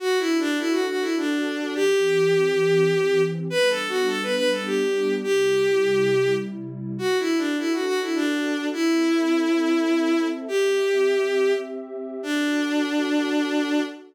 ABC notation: X:1
M:3/4
L:1/16
Q:1/4=103
K:Dmix
V:1 name="Violin"
(3F2 E2 D2 E F F E D4 | G12 | (3B2 A2 F2 A B B A G4 | G8 z4 |
(3F2 E2 D2 E F F E D4 | E12 | G8 z4 | D12 |]
V:2 name="Pad 2 (warm)"
[DFA]12 | [E,CG]12 | [G,B,D]12 | [C,G,E]12 |
[DFA]12 | [CAe]12 | [CGe]12 | [DFA]12 |]